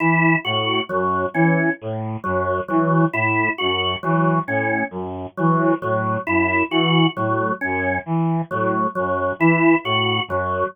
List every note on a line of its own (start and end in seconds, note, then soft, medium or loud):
0.00 0.35 E3 medium
0.00 0.36 E4 medium
0.45 0.81 A2 medium
0.45 0.80 F#4 medium
0.89 1.26 F#2 medium
0.89 1.25 F#3 medium
1.34 1.70 E3 medium
1.34 1.70 C#4 medium
1.81 2.17 A2 medium
2.24 2.61 F#2 medium
2.24 2.60 F#3 medium
2.68 3.05 E3 medium
2.68 3.04 F#3 medium
3.13 3.49 A2 medium
3.13 3.49 E4 medium
3.58 3.96 F#2 medium
3.58 3.94 F#4 medium
4.03 4.39 E3 medium
4.03 4.39 F#3 medium
4.47 4.83 A2 medium
4.47 4.84 C#4 medium
4.91 5.27 F#2 medium
5.37 5.74 E3 medium
5.37 5.73 F#3 medium
5.82 6.17 A2 medium
5.82 6.18 F#3 medium
6.27 6.63 F#2 medium
6.27 6.63 E4 medium
6.71 7.06 E3 medium
6.71 7.07 F#4 medium
7.16 7.52 A2 medium
7.16 7.52 F#3 medium
7.61 7.99 F#2 medium
7.61 7.97 C#4 medium
8.06 8.42 E3 medium
8.51 8.87 A2 medium
8.51 8.87 F#3 medium
8.95 9.33 F#2 medium
8.95 9.31 F#3 medium
9.39 9.75 E3 medium
9.39 9.76 E4 medium
9.84 10.20 A2 medium
9.84 10.21 F#4 medium
10.28 10.64 F#2 medium
10.28 10.66 F#3 medium